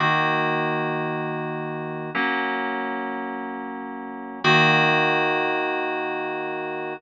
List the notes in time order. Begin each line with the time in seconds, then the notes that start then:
0.00 D#3 A#3 F#4
2.15 F#3 A#3 C#4
4.44 D#3 A#3 F#4